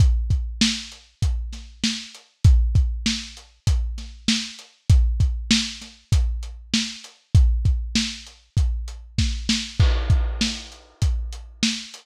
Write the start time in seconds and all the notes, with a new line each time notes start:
0.00 kick, closed hi-hat
0.30 kick, closed hi-hat
0.61 snare
0.92 closed hi-hat
1.22 kick, closed hi-hat
1.53 snare, closed hi-hat
1.84 snare
2.15 closed hi-hat
2.44 kick, closed hi-hat
2.75 kick, closed hi-hat
3.06 snare
3.37 closed hi-hat
3.67 kick, closed hi-hat
3.98 snare, closed hi-hat
4.28 snare
4.59 closed hi-hat
4.90 kick, closed hi-hat
5.20 kick, closed hi-hat
5.51 snare
5.82 snare, closed hi-hat
6.12 kick, closed hi-hat
6.43 closed hi-hat
6.74 snare
7.04 closed hi-hat
7.35 kick, closed hi-hat
7.65 kick, closed hi-hat
7.95 snare
8.27 closed hi-hat
8.57 kick, closed hi-hat
8.88 closed hi-hat
9.18 kick, snare
9.49 snare
9.80 kick, crash
10.10 kick, closed hi-hat
10.41 snare
10.72 closed hi-hat
11.02 kick, closed hi-hat
11.33 closed hi-hat
11.63 snare
11.94 closed hi-hat